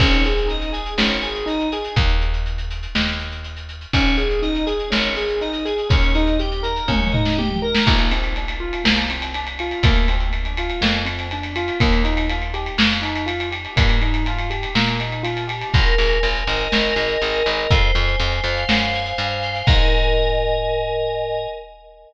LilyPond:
<<
  \new Staff \with { instrumentName = "Acoustic Grand Piano" } { \time 2/2 \key aes \major \tempo 2 = 61 des'8 aes'8 ees'8 aes'8 des'8 aes'8 ees'8 aes'8 | r1 | des'8 aes'8 ees'8 aes'8 des'8 aes'8 ees'8 aes'8 | des'8 ees'8 g'8 bes'8 des'8 ees'8 g'8 bes'8 |
\key bes \major bes8 c'8 d'8 f'8 bes8 c'8 d'8 f'8 | bes8 c'8 d'8 f'8 bes8 c'8 d'8 f'8 | bes8 ees'8 f'8 g'8 bes8 ees'8 f'8 g'8 | bes8 ees'8 f'8 g'8 bes8 ees'8 f'8 g'8 |
\key aes \major r1 | r1 | r1 | }
  \new Staff \with { instrumentName = "Electric Piano 2" } { \time 2/2 \key aes \major des''8 aes''8 ees''8 aes''8 des''8 aes''8 ees''8 aes''8 | r1 | des''8 aes''8 ees''8 aes''8 des''8 aes''8 ees''8 aes''8 | des''8 ees''8 g''8 bes''8 des''8 ees''8 g''8 bes''8 |
\key bes \major r1 | r1 | r1 | r1 |
\key aes \major bes'8 aes''8 bes'8 ees''8 bes'8 aes''8 ees''8 bes'8 | c''8 aes''8 c''8 f''8 c''8 aes''8 f''8 c''8 | <bes' ees'' aes''>1 | }
  \new Staff \with { instrumentName = "Electric Bass (finger)" } { \clef bass \time 2/2 \key aes \major aes,,2 aes,,2 | ees,2 ees,2 | aes,,2 aes,,2 | ees,2 ees,2 |
\key bes \major bes,,2 c,2 | d,2 f,2 | ees,2 f,2 | g,2 bes,2 |
\key aes \major aes,,8 aes,,8 aes,,8 aes,,8 aes,,8 aes,,8 aes,,8 aes,,8 | f,8 f,8 f,8 f,8 ges,4 g,4 | aes,1 | }
  \new DrumStaff \with { instrumentName = "Drums" } \drummode { \time 2/2 <cymc bd>16 hh16 hh16 hh16 hh16 hh16 hh16 hh16 sn16 hh16 hh16 hh16 hh16 hh16 hh16 hh16 | <hh bd>16 hh16 hh16 hh16 hh16 hh16 hh16 hh16 sn16 hh16 hh16 hh16 hh16 hh16 hh16 hh16 | <hh bd>16 hh16 hh16 hh16 hh16 hh16 hh16 hh16 sn16 hh16 hh16 hh16 hh16 hh16 hh16 hh16 | <hh bd>16 hh16 hh16 hh16 hh16 hh16 hh16 hh16 <bd tommh>16 toml16 tomfh16 sn16 tommh16 toml8 sn16 |
<cymc bd>16 cymr16 cymr16 cymr16 cymr16 cymr8 cymr16 sn16 cymr16 cymr16 cymr16 cymr16 cymr16 cymr16 cymr16 | <bd cymr>16 cymr16 cymr16 cymr16 cymr16 cymr16 cymr16 cymr16 sn16 cymr16 cymr16 cymr16 cymr16 cymr16 cymr16 cymr16 | <bd cymr>16 cymr16 cymr16 cymr16 cymr16 cymr16 cymr16 cymr16 sn16 cymr16 cymr16 cymr16 cymr16 cymr16 cymr16 cymr16 | <bd cymr>16 cymr16 cymr16 cymr16 cymr16 cymr16 cymr16 cymr16 sn16 cymr16 cymr16 cymr16 cymr16 cymr16 cymr16 cymr16 |
<hh bd>16 hh16 hh16 hh16 hh16 hh16 hh16 hh16 sn16 hh16 hh16 hh16 hh16 hh16 hh16 hh16 | <hh bd>8 hh16 hh16 hh16 hh16 hh16 hh16 sn16 hh16 hh16 hh16 hh16 hh16 hh16 hh16 | <cymc bd>2 r2 | }
>>